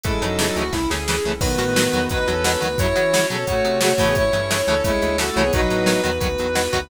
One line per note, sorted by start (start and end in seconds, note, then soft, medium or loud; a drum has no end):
0.03 0.19 A1 loud
0.03 0.11 C#3 loud
0.03 0.11 E3 loud
0.03 0.21 G#3 medium
0.03 0.11 A3 loud
0.03 1.40 C#4 loud
0.03 1.40 E4 medium
0.03 0.21 E4 medium
0.03 0.35 A4 medium
0.03 1.40 A4 medium
0.03 kick loud
0.03 closed hi-hat loud
0.22 0.51 F#2 medium
0.22 0.29 C#3 medium
0.22 0.29 E3 medium
0.22 0.63 F#3 medium
0.22 0.29 A3 medium
0.22 0.63 D#4 medium
0.22 closed hi-hat medium
0.39 0.46 C#3 medium
0.39 0.46 E3 medium
0.39 0.46 A3 medium
0.39 0.55 A4 medium
0.39 snare loud
0.56 0.70 D2 medium
0.56 0.63 C#3 medium
0.56 0.63 E3 medium
0.56 0.63 A3 medium
0.56 0.71 F#4 medium
0.56 closed hi-hat medium
0.73 0.87 C2 medium
0.73 0.79 C#3 medium
0.73 0.79 E3 medium
0.73 0.79 A3 medium
0.73 0.87 E4 medium
0.73 kick medium
0.73 snare medium
0.90 1.20 D2 medium
0.90 0.98 C#3 medium
0.90 0.98 E3 medium
0.90 0.98 A3 medium
0.90 1.20 G#4 medium
0.90 snare medium
1.08 1.15 C#3 medium
1.08 1.15 E3 medium
1.08 1.15 A3 medium
1.08 snare loud
1.25 1.39 C2 medium
1.25 1.32 C#3 medium
1.25 1.32 E3 medium
1.25 1.32 A3 medium
1.41 1.56 B1 loud
1.41 1.48 B2 medium
1.41 1.48 D#3 medium
1.41 2.08 D#3 medium
1.41 1.48 F#3 loud
1.41 2.77 B3 medium
1.41 2.08 B3 loud
1.41 2.77 D#4 medium
1.41 2.77 F#4 medium
1.41 1.97 B4 medium
1.41 kick loud
1.41 crash loud
1.58 1.88 A2 medium
1.58 1.65 B2 medium
1.58 1.65 D#3 medium
1.58 1.65 F#3 medium
1.58 closed hi-hat medium
1.76 1.83 B2 medium
1.76 1.83 D#3 medium
1.76 1.83 F#3 medium
1.76 snare loud
1.93 2.08 E2 medium
1.93 2.00 B2 medium
1.93 2.00 D#3 medium
1.93 2.00 F#3 medium
1.93 closed hi-hat medium
2.09 2.25 D2 medium
2.09 2.18 B2 medium
2.09 2.18 D#3 medium
2.09 2.18 F#3 medium
2.09 2.27 D#4 medium
2.09 2.38 B4 medium
2.09 2.27 B4 medium
2.09 kick loud
2.09 closed hi-hat loud
2.27 2.57 E2 medium
2.27 2.34 B2 medium
2.27 2.34 D#3 medium
2.27 2.34 F#3 medium
2.27 2.61 C#4 medium
2.27 2.61 A4 medium
2.27 closed hi-hat medium
2.44 2.51 B2 medium
2.44 2.51 D#3 medium
2.44 2.51 F#3 medium
2.44 2.60 B4 medium
2.44 snare loud
2.61 2.76 D2 medium
2.61 2.68 B2 medium
2.61 2.68 D#3 medium
2.61 2.68 F#3 medium
2.61 2.78 B4 medium
2.61 closed hi-hat medium
2.78 2.93 F#2 medium
2.78 2.86 C#3 loud
2.78 2.86 F#3 loud
2.78 4.15 C#4 medium
2.78 3.26 E4 medium
2.78 4.15 F#4 medium
2.78 3.26 C#5 medium
2.78 3.41 C#5 medium
2.78 kick loud
2.78 closed hi-hat loud
2.96 3.02 C#3 medium
2.96 3.25 E3 medium
2.96 3.02 F#3 medium
2.96 closed hi-hat medium
3.13 3.20 C#3 medium
3.13 3.20 F#3 medium
3.13 snare loud
3.30 3.45 B2 medium
3.30 3.36 C#3 medium
3.30 3.36 F#3 medium
3.30 3.45 C#4 medium
3.30 3.45 A4 medium
3.30 closed hi-hat medium
3.47 3.62 A2 medium
3.47 3.54 C#3 medium
3.47 3.54 F#3 medium
3.47 3.79 A3 medium
3.47 3.79 F#4 medium
3.47 3.79 C#5 medium
3.47 kick loud
3.47 closed hi-hat loud
3.64 3.94 C3 medium
3.64 3.71 C#3 medium
3.64 3.71 F#3 medium
3.64 closed hi-hat medium
3.81 3.90 C#3 medium
3.81 3.90 F#3 medium
3.81 3.93 A3 medium
3.81 3.93 F#4 loud
3.81 3.95 C#5 medium
3.81 snare loud
3.93 4.04 A3 medium
3.93 4.04 F#4 medium
3.98 4.13 A2 medium
3.98 4.23 C#3 loud
3.98 4.23 E3 medium
3.98 4.23 A3 loud
3.98 4.13 C#5 medium
3.98 kick medium
3.98 open hi-hat medium
4.04 4.15 B3 medium
4.04 4.15 G#4 medium
4.15 4.31 A1 loud
4.15 5.52 C#4 medium
4.15 4.61 E4 medium
4.15 5.52 E4 medium
4.15 5.52 A4 medium
4.15 4.61 C#5 medium
4.15 4.76 C#5 medium
4.15 kick loud
4.15 closed hi-hat loud
4.33 4.62 G2 medium
4.33 4.40 C#3 medium
4.33 4.40 E3 medium
4.33 4.40 A3 medium
4.33 closed hi-hat medium
4.51 4.57 C#3 medium
4.51 4.57 E3 medium
4.51 4.57 A3 medium
4.51 snare loud
4.67 4.82 D2 medium
4.67 4.75 C#3 medium
4.67 4.75 E3 medium
4.67 4.75 A3 medium
4.67 4.82 C#4 medium
4.67 4.82 A4 medium
4.67 closed hi-hat medium
4.84 4.99 C2 medium
4.84 4.91 C#3 medium
4.84 4.91 E3 medium
4.84 5.16 G#3 medium
4.84 4.91 A3 medium
4.84 5.16 E4 loud
4.84 5.12 C#5 medium
4.84 kick loud
4.84 closed hi-hat loud
5.02 5.31 D2 medium
5.02 5.09 C#3 medium
5.02 5.09 E3 medium
5.02 5.09 A3 medium
5.02 closed hi-hat medium
5.18 5.26 C#3 medium
5.18 5.26 E3 medium
5.18 5.29 A3 medium
5.18 5.26 A3 medium
5.18 5.29 F#4 medium
5.18 5.35 A4 medium
5.18 snare loud
5.31 5.42 A3 medium
5.31 5.42 F#4 medium
5.36 5.51 C2 medium
5.36 5.44 C#3 medium
5.36 5.44 E3 medium
5.36 5.44 A3 medium
5.36 5.52 C#5 medium
5.36 closed hi-hat medium
5.41 5.52 B3 medium
5.41 5.52 G#4 medium
5.52 5.68 B1 loud
5.52 5.60 B2 loud
5.52 5.60 D#3 loud
5.52 6.01 F#3 medium
5.52 5.60 F#3 loud
5.52 6.89 B3 medium
5.52 6.01 D#4 loud
5.52 6.89 D#4 medium
5.52 6.89 F#4 medium
5.52 6.15 B4 medium
5.52 kick loud
5.52 closed hi-hat loud
5.70 5.99 A2 medium
5.70 5.77 B2 medium
5.70 5.77 D#3 medium
5.70 5.77 F#3 medium
5.70 closed hi-hat medium
5.86 5.93 B2 medium
5.86 5.93 D#3 medium
5.86 5.93 F#3 medium
5.86 snare loud
6.04 6.19 E2 medium
6.04 6.10 B2 medium
6.04 6.10 D#3 medium
6.04 6.10 F#3 medium
6.04 closed hi-hat medium
6.20 6.36 D2 medium
6.20 6.27 B2 medium
6.20 6.27 D#3 medium
6.20 6.27 F#3 medium
6.20 6.50 B4 medium
6.20 kick loud
6.20 closed hi-hat loud
6.38 6.68 E2 medium
6.38 6.46 B2 medium
6.38 6.46 D#3 medium
6.38 6.46 F#3 medium
6.38 closed hi-hat medium
6.55 6.62 B2 medium
6.55 6.62 D#3 loud
6.55 6.62 F#3 medium
6.55 6.71 B4 medium
6.55 snare loud
6.73 6.88 D2 medium
6.73 6.80 B2 medium
6.73 6.80 D#3 medium
6.73 6.80 F#3 medium
6.73 6.90 B4 medium
6.73 kick medium
6.73 closed hi-hat medium